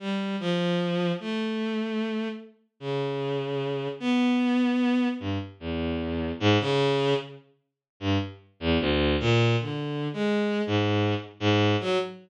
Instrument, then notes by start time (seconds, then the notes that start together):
violin
0.00 G3
0.40 F3
1.20 A3
2.80 C#3
4.00 B3
5.20 G2
5.60 E2
6.40 G#2
6.60 C#3
8.00 G2
8.60 E2
8.80 D2
9.20 A#2
9.60 D3
10.13 G#3
10.67 G#2
11.40 G#2
11.80 F#3